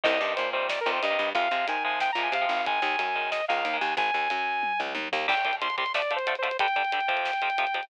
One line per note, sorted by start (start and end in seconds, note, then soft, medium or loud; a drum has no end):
0.03 0.19 C2 medium
0.03 0.17 C3 medium
0.03 0.17 D#3 medium
0.03 0.17 G3 medium
0.03 0.34 D#5 loud
0.03 kick loud
0.03 crash loud
0.20 0.35 G2 medium
0.20 0.47 C3 medium
0.20 0.47 D#3 medium
0.20 0.47 G3 medium
0.36 0.80 A#2 medium
0.36 0.50 C5 medium
0.36 closed hi-hat loud
0.53 0.79 C3 medium
0.53 0.79 D#3 medium
0.53 0.79 G3 medium
0.53 0.67 C5 medium
0.69 0.80 D5 medium
0.69 snare loud
0.81 0.91 A#4 medium
0.86 1.00 F2 medium
0.86 1.06 C3 medium
0.86 1.06 D#3 medium
0.86 1.06 G3 medium
0.92 1.02 C5 medium
1.02 1.17 G2 medium
1.02 1.30 D#5 medium
1.02 closed hi-hat medium
1.10 1.30 C3 medium
1.10 1.30 D#3 medium
1.10 1.30 G3 medium
1.19 1.33 G2 medium
1.35 1.49 F2 medium
1.35 1.48 C3 medium
1.35 1.48 F3 medium
1.35 1.48 G#3 medium
1.35 1.67 F5 medium
1.35 kick loud
1.35 closed hi-hat medium
1.51 1.65 C3 medium
1.51 1.78 C3 medium
1.51 1.78 F3 medium
1.51 1.78 G#3 medium
1.68 2.10 D#3 medium
1.68 1.83 G#5 medium
1.68 closed hi-hat loud
1.84 2.11 C3 medium
1.84 2.11 F3 medium
1.84 2.11 G#3 medium
1.84 1.99 G#5 medium
2.00 2.11 G5 medium
2.00 snare loud
2.12 2.29 A#2 medium
2.12 2.22 A#5 medium
2.17 2.37 C3 medium
2.17 2.37 F3 medium
2.17 2.37 G#3 medium
2.23 2.33 G#5 medium
2.32 2.46 C3 medium
2.32 2.65 F5 medium
2.32 closed hi-hat loud
2.41 2.61 C3 medium
2.41 2.61 F3 medium
2.41 2.61 G#3 medium
2.49 2.79 G#1 medium
2.66 2.80 D#3 medium
2.66 2.80 G#3 medium
2.66 3.30 G#5 medium
2.66 kick loud
2.66 closed hi-hat medium
2.82 2.96 D#2 medium
2.82 3.09 D#3 medium
2.82 3.09 G#3 medium
2.99 3.41 F#2 medium
2.99 closed hi-hat loud
3.15 3.42 D#3 medium
3.15 3.42 G#3 medium
3.31 3.45 D#5 medium
3.31 snare loud
3.48 3.64 C#2 medium
3.48 3.69 D#3 medium
3.48 3.69 G#3 medium
3.48 3.77 F5 medium
3.65 3.79 D#2 medium
3.65 closed hi-hat medium
3.74 3.93 D#3 medium
3.74 3.93 G#3 medium
3.81 3.95 D#2 medium
3.81 3.94 G#5 medium
3.97 4.11 G#1 medium
3.97 4.81 G#5 loud
3.97 kick loud
3.97 closed hi-hat medium
4.14 4.28 D#2 medium
4.30 4.73 F#2 medium
4.30 closed hi-hat loud
4.63 kick medium
4.63 high tom medium
4.79 4.94 C#2 medium
4.79 floor tom medium
4.95 5.09 D#2 medium
4.95 high tom medium
5.12 5.27 D#2 medium
5.12 floor tom loud
5.28 5.34 C2 medium
5.28 5.34 C3 medium
5.28 5.34 G3 medium
5.28 5.56 G5 medium
5.28 kick medium
5.28 crash loud
5.37 closed hi-hat medium
5.45 5.52 C2 medium
5.45 5.52 C3 medium
5.45 5.52 G3 medium
5.45 kick medium
5.45 closed hi-hat medium
5.53 closed hi-hat medium
5.61 5.68 C2 medium
5.61 5.68 C3 medium
5.61 5.68 G3 medium
5.61 5.76 C6 medium
5.61 closed hi-hat medium
5.70 closed hi-hat medium
5.78 5.84 C2 medium
5.78 5.84 C3 medium
5.78 5.84 G3 medium
5.78 5.92 C6 medium
5.78 kick medium
5.78 closed hi-hat medium
5.86 closed hi-hat medium
5.94 6.01 D3 medium
5.94 6.01 F3 medium
5.94 6.01 A3 medium
5.94 6.13 D5 medium
5.94 snare loud
6.02 closed hi-hat medium
6.11 6.18 D3 medium
6.11 6.18 F3 medium
6.11 6.18 A3 medium
6.11 closed hi-hat medium
6.16 6.35 C5 medium
6.16 closed hi-hat medium
6.27 6.34 D3 medium
6.27 6.34 F3 medium
6.27 6.34 A3 medium
6.27 closed hi-hat loud
6.35 6.57 C5 medium
6.35 closed hi-hat medium
6.42 6.49 D3 medium
6.42 6.49 F3 medium
6.42 6.49 A3 medium
6.42 closed hi-hat medium
6.51 closed hi-hat medium
6.59 6.67 G2 medium
6.59 6.67 D3 medium
6.59 6.67 G3 medium
6.59 7.85 G5 loud
6.59 kick loud
6.59 closed hi-hat loud
6.68 closed hi-hat medium
6.76 6.83 G2 medium
6.76 6.83 D3 medium
6.76 6.83 G3 medium
6.76 kick medium
6.76 closed hi-hat medium
6.85 closed hi-hat medium
6.92 7.00 G2 medium
6.92 7.00 D3 medium
6.92 7.00 G3 medium
6.92 closed hi-hat loud
7.01 closed hi-hat medium
7.08 7.31 F2 medium
7.08 7.31 C3 medium
7.08 7.31 F3 medium
7.08 kick medium
7.08 closed hi-hat medium
7.17 closed hi-hat medium
7.25 snare loud
7.33 closed hi-hat medium
7.42 7.49 F2 medium
7.42 7.49 C3 medium
7.42 7.49 F3 medium
7.42 closed hi-hat medium
7.50 closed hi-hat medium
7.58 7.65 F2 medium
7.58 7.65 C3 medium
7.58 7.65 F3 medium
7.58 closed hi-hat loud
7.67 closed hi-hat medium
7.74 7.81 F2 medium
7.74 7.81 C3 medium
7.74 7.81 F3 medium
7.74 closed hi-hat medium
7.83 closed hi-hat medium